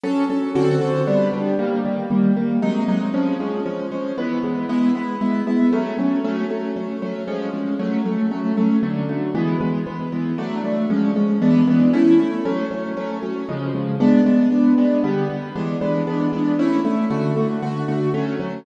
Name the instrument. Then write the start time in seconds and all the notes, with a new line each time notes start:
acoustic grand piano
0.03 F#3 C#4 A4
0.30 F#3 C#4 A4
0.55 D3 C4 F#4 A4
0.81 D3 C4 F#4 A4
1.07 G3 B3 D4
1.33 G3 B3 D4
1.59 D#3 G3 A#3
1.85 D#3 G3 A#3
2.10 D#3 G3 A#3
2.36 D#3 G3 A#3
2.62 C3 F#3 G#3 D#4
2.88 C3 F#3 G#3 D#4
3.14 F3 G#3 C#4
3.40 F3 G#3 C#4
3.66 F3 G#3 C#4
3.91 F3 G#3 C#4
4.18 E3 G#3 B3
4.43 E3 G#3 B3
4.69 G#3 B3 E4
4.95 G#3 B3 E4
5.21 G#3 B3 E4
5.47 G#3 B3 E4
5.73 F#3 A3 C#4
5.98 F#3 A3 C#4
6.24 F#3 A3 C#4
6.50 F#3 A3 C#4
6.76 F#3 A3 C#4
7.02 F#3 A3 C#4
7.28 F3 G#3 C#4
7.54 F3 G#3 C#4
7.79 F#3 A3 C#4
8.05 F#3 A3 C#4
8.31 F#3 A3 C#4
8.57 F#3 A3 C#4
8.83 D3 F#3 A3
9.09 D3 F#3 A3
9.35 E3 G#3 B3
9.61 E3 G#3 B3
9.87 E3 G#3 B3
10.12 E3 G#3 B3
10.38 F#3 A3 D4
10.64 F#3 A3 D4
10.90 F3 G#3 C#4
11.16 F3 G#3 C#4
11.42 E3 G#3 B3 D4
11.67 E3 G#3 B3 D4
11.93 A3 C#4 E4
12.19 A3 C#4 E4
12.45 F#3 A3 C#4
12.71 F#3 A3 C#4
12.97 F#3 A3 C#4
13.23 F#3 A3 C#4
13.49 C#3 F3 G#3
13.74 C#3 F3 G#3
14.00 G#3 B3 D4
14.26 G#3 B3 D4
14.52 G#3 B3 D4
14.78 G#3 B3 D4
15.04 D3 G3 B3
15.30 D3 G3 B3
15.55 E3 G#3 B3 D4
15.81 E3 G#3 B3 D4
16.07 E3 G#3 B3 D4
16.33 E3 G#3 B3 D4
16.59 A3 C#4 E4
16.85 A3 C#4 E4
17.10 D3 A3 F#4
17.36 D3 A3 F#4
17.62 D3 A3 F#4
17.88 D3 A3 F#4
18.14 F#3 A3 C#4
18.40 F#3 A3 C#4